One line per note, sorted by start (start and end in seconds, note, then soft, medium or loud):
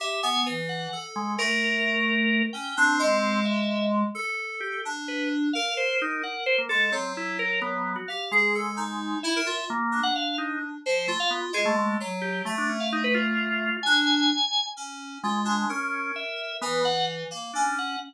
0.00 0.20 G4 medium
0.00 0.22 E5 medium
0.23 0.43 B3 loud
0.23 0.44 G#5 medium
0.46 0.87 E3 medium
0.69 1.00 F#5 medium
0.93 1.34 A4 medium
1.16 1.37 G#3 loud
1.38 2.42 A3 medium
1.38 2.42 A#4 loud
2.53 2.74 C#4 medium
2.53 2.74 G5 medium
2.77 3.40 C4 medium
2.77 2.98 D4 loud
2.99 4.03 G#3 loud
3.45 3.87 E5 medium
4.15 4.77 A4 loud
4.60 4.81 G4 medium
4.85 5.47 D4 medium
5.08 5.29 B4 medium
5.53 6.59 A#4 medium
5.53 5.74 F5 medium
5.77 5.98 C5 medium
6.02 6.22 D#4 loud
6.23 6.44 F#5 medium
6.46 6.57 C5 loud
6.58 6.69 A#3 medium
6.69 6.90 G#3 medium
6.69 6.90 A4 loud
6.92 7.96 F#3 medium
6.92 7.13 C4 medium
7.17 7.38 E4 medium
7.39 7.60 A#4 loud
7.62 7.93 B3 loud
7.96 8.06 F#4 medium
8.08 8.30 G4 medium
8.08 8.29 F5 medium
8.31 9.15 G#3 medium
8.31 8.52 G#4 loud
8.55 8.76 A4 medium
8.77 9.18 D#4 medium
9.23 9.34 E4 loud
9.23 9.65 E5 medium
9.36 9.46 A#4 loud
9.46 9.67 F4 medium
9.70 10.01 A#3 loud
9.92 10.75 D4 soft
10.03 10.14 F#5 loud
10.15 10.36 F5 medium
10.38 10.59 D#4 medium
10.86 11.06 F3 medium
10.86 11.07 C5 medium
11.07 11.18 A3 medium
11.07 11.49 F4 medium
11.20 11.30 F5 loud
11.30 11.41 B3 medium
11.53 11.94 G#3 medium
11.53 11.65 G#4 loud
11.65 11.76 A3 loud
11.77 11.97 A3 medium
12.00 12.42 F#3 medium
12.22 12.42 G4 medium
12.45 12.55 A3 medium
12.45 13.70 A3 medium
12.58 12.68 D4 medium
12.69 12.80 C#4 medium
12.80 12.90 F5 medium
12.92 13.03 D#4 loud
13.04 13.14 B4 loud
13.14 13.77 F4 loud
13.83 14.27 D4 loud
13.83 14.66 G#5 loud
14.77 15.18 C#4 medium
15.24 15.65 G#3 loud
15.24 15.44 F4 medium
15.45 15.66 D4 medium
15.69 16.12 C#4 loud
15.69 16.52 A#4 medium
16.16 16.57 E5 medium
16.61 17.24 E3 medium
16.61 16.82 B3 loud
16.85 17.06 F#5 loud
17.31 17.51 A#3 medium
17.53 17.96 C#4 medium
17.53 17.74 D4 medium
17.79 17.99 F#5 medium